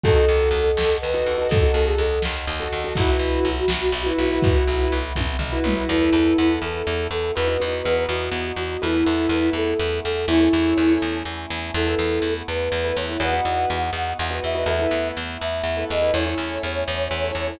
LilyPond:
<<
  \new Staff \with { instrumentName = "Flute" } { \time 6/8 \key e \major \tempo 4. = 82 a'2 b'4 | a'8 a'16 gis'16 a'8 r4. | fis'2~ fis'8 fis'8 | fis'4 r2 |
e'4. a'4 a'8 | b'4. fis'4 fis'8 | e'4. a'4 a'8 | e'4. r4. |
a'4. b'4 cis''8 | fis''2~ fis''8 e''8 | e''4 r8 e''4 dis''8 | cis''2. | }
  \new Staff \with { instrumentName = "Acoustic Grand Piano" } { \time 6/8 \key e \major <dis' fis' a'>16 <dis' fis' a'>2 <dis' fis' a'>8 <dis' fis' a'>16~ | <dis' fis' a'>16 <dis' fis' a'>2 <dis' fis' a'>8 <dis' fis' a'>16 | <e' fis' b'>16 <e' fis' b'>2 <e' fis' b'>8 <e' fis' b'>16~ | <e' fis' b'>16 <e' fis' b'>2 <e' fis' b'>8 <e' fis' b'>16 |
<e' a' b'>16 <e' a' b'>16 <e' a' b'>8 <e' a' b'>2 | <dis' fis' b'>16 <dis' fis' b'>16 <dis' fis' b'>8 <dis' fis' b'>2 | <e' a' b'>16 <e' a' b'>16 <e' a' b'>8 <e' a' b'>2 | <e' a' cis''>16 <e' a' cis''>16 <e' a' cis''>8 <e' a' cis''>2 |
<e' a' b'>16 <e' a' b'>2 <e' a' b'>8 <e' a' b'>16 | <dis' fis' b'>16 <dis' fis' b'>2 <dis' fis' b'>8 <dis' fis' b'>16 | <e' a' b'>16 <e' a' b'>2 <e' a' b'>8 <e' a' b'>16 | <e' a' cis''>16 <e' a' cis''>2 <e' a' cis''>8 <e' a' cis''>16 | }
  \new Staff \with { instrumentName = "Electric Bass (finger)" } { \clef bass \time 6/8 \key e \major dis,8 dis,8 dis,8 dis,8 dis,8 dis,8 | dis,8 dis,8 dis,8 dis,8 dis,8 dis,8 | b,,8 b,,8 b,,8 b,,8 b,,8 b,,8 | b,,8 b,,8 b,,8 b,,8 b,,8 b,,8 |
e,8 e,8 e,8 e,8 e,8 e,8 | e,8 e,8 e,8 e,8 e,8 e,8 | e,8 e,8 e,8 e,8 e,8 e,8 | e,8 e,8 e,8 e,8 e,8 e,8 |
e,8 e,8 e,8 e,8 e,8 e,8 | e,8 e,8 e,8 e,8 e,8 e,8 | e,8 e,8 e,8 e,8 e,8 e,8 | e,8 e,8 e,8 e,8 e,8 e,8 | }
  \new Staff \with { instrumentName = "Choir Aahs" } { \time 6/8 \key e \major <dis'' fis'' a''>2.~ | <dis'' fis'' a''>2. | <e'' fis'' b''>2.~ | <e'' fis'' b''>2. |
<b e' a'>2. | <b dis' fis'>2. | <a b e'>2. | <a cis' e'>2. |
<a b e'>2. | <b dis' fis'>2. | <a b e'>2. | <a cis' e'>2. | }
  \new DrumStaff \with { instrumentName = "Drums" } \drummode { \time 6/8 <hh bd>8. hh8. sn8. hh8. | <hh bd>8. hh8. sn8. hh8. | <hh bd>8. hh8. sn8. hh8. | <hh bd>8. hh8. <bd tommh>8 tomfh8 toml8 |
r4. r4. | r4. r4. | r4. r4. | r4. r4. |
r4. r4. | r4. r4. | r4. r4. | r4. r4. | }
>>